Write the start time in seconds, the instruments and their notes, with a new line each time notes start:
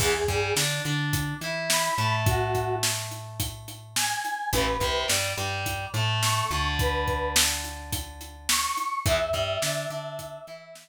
0.00 electric bass (finger) E2, overdriven guitar E3 B3, lead 1 (square) G#4, kick, crash
0.28 electric bass (finger) G2, overdriven guitar G3, kick, closed hi-hat
0.56 electric bass (finger) D3, overdriven guitar D4, snare
0.85 electric bass (finger) D3, overdriven guitar D4, closed hi-hat
1.13 kick, closed hi-hat
1.41 electric bass (finger) E3, overdriven guitar E4, closed hi-hat
1.70 lead 1 (square) B5, snare
1.98 electric bass (finger) A2, overdriven guitar A3, closed hi-hat
2.26 lead 1 (square) F#4, kick, closed hi-hat
2.55 kick, closed hi-hat
2.83 snare
3.11 closed hi-hat
3.40 kick, closed hi-hat
3.68 closed hi-hat
3.96 lead 1 (square) G#5, snare
4.25 closed hi-hat
4.53 electric bass (finger) A1, overdriven guitar E3 A3, lead 1 (square) B4, kick, closed hi-hat
4.80 electric bass (finger) C2, overdriven guitar C3, kick, closed hi-hat
5.08 electric bass (finger) G2, overdriven guitar G3, snare
5.37 electric bass (finger) G2, overdriven guitar G3, closed hi-hat
5.66 kick, closed hi-hat
5.94 electric bass (finger) A2, overdriven guitar A3, closed hi-hat
6.23 lead 1 (square) C#6, snare
6.51 electric bass (finger) D2, overdriven guitar D3, closed hi-hat
6.79 lead 1 (square) B4, kick, closed hi-hat
7.08 kick, closed hi-hat
7.36 snare
7.64 closed hi-hat
7.92 kick, closed hi-hat
8.21 closed hi-hat
8.49 lead 1 (square) C#6, snare
8.77 closed hi-hat
9.06 electric bass (finger) E2, overdriven guitar E3 B3, lead 1 (square) E5, kick, closed hi-hat
9.33 electric bass (finger) G2, overdriven guitar G3, kick, closed hi-hat
9.62 electric bass (finger) D3, overdriven guitar D4, snare
9.90 electric bass (finger) D3, overdriven guitar D4, closed hi-hat
10.19 kick, closed hi-hat
10.47 electric bass (finger) E3, overdriven guitar E4, closed hi-hat
10.75 snare